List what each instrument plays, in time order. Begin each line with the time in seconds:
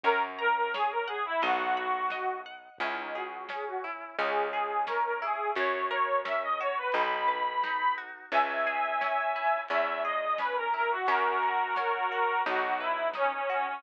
0.04 electric bass (finger) F#2, accordion A#4, acoustic guitar (steel) C#5, kick, closed hi-hat
0.39 accordion A#4, acoustic guitar (steel) A#5
0.55 accordion A#4
0.74 accordion G#4, acoustic guitar (steel) C#5, snare
0.91 accordion A#4
1.07 accordion G#4, acoustic guitar (steel) F#5
1.25 accordion E4
1.42 electric bass (finger) B1, accordion F#4, acoustic guitar (steel) D#5, closed hi-hat
1.77 acoustic guitar (steel) B5
2.10 acoustic guitar (steel) D#5, snare
2.46 acoustic guitar (steel) F#5
2.78 electric bass (finger) C#2, acoustic guitar (steel) C#4, accordion E4, kick, closed hi-hat
2.98 accordion D#4
3.14 accordion F#4, acoustic guitar (steel) G#4
3.49 acoustic guitar (steel) C#4, accordion G#4, snare
3.67 accordion F#4
3.84 acoustic guitar (steel) E4
4.18 electric bass (finger) C#2, acoustic guitar (steel) C#4, accordion G#4, closed hi-hat
4.52 accordion G#4, acoustic guitar (steel) G#4
4.87 acoustic guitar (steel) C#4, accordion A#4, snare
5.04 accordion A#4
5.22 acoustic guitar (steel) E4, accordion G#4
5.55 electric bass (finger) F#2, acoustic guitar (steel) C#4, accordion C#5, kick, closed hi-hat
5.90 acoustic guitar (steel) A#4, accordion C#5
6.25 acoustic guitar (steel) C#4, accordion E5, snare
6.42 accordion D#5
6.60 acoustic guitar (steel) F#4, accordion C#5
6.77 accordion B4
6.92 electric bass (finger) B1, acoustic guitar (steel) D#4, accordion B5, closed hi-hat
7.28 acoustic guitar (steel) B4
7.64 acoustic guitar (steel) D#4, snare
7.98 acoustic guitar (steel) F#4
8.32 electric bass (finger) C#2, acoustic guitar (steel) C#4, accordion E5 G#5, kick, closed hi-hat
8.67 acoustic guitar (steel) G#4
9.01 acoustic guitar (steel) C#4, snare
9.36 acoustic guitar (steel) E4
9.69 electric bass (finger) E2, acoustic guitar (steel) C#4, accordion E5, closed hi-hat
10.04 acoustic guitar (steel) G#4, accordion D#5
10.38 acoustic guitar (steel) C#4, accordion B4, snare
10.56 accordion A#4
10.74 acoustic guitar (steel) E4, accordion A#4
10.90 accordion F#4
11.07 electric bass (finger) F#2, acoustic guitar (steel) C#4, accordion F#4 A#4, kick, closed hi-hat
11.43 acoustic guitar (steel) A#4
11.76 acoustic guitar (steel) C#4, snare
12.12 acoustic guitar (steel) F#4
12.46 electric bass (finger) B1, acoustic guitar (steel) D#4, accordion F#4, closed hi-hat
12.80 accordion E4, acoustic guitar (steel) B4
13.14 accordion C#4, acoustic guitar (steel) D#4, snare
13.32 accordion C#4
13.49 accordion C#4, acoustic guitar (steel) F#4
13.67 accordion C#4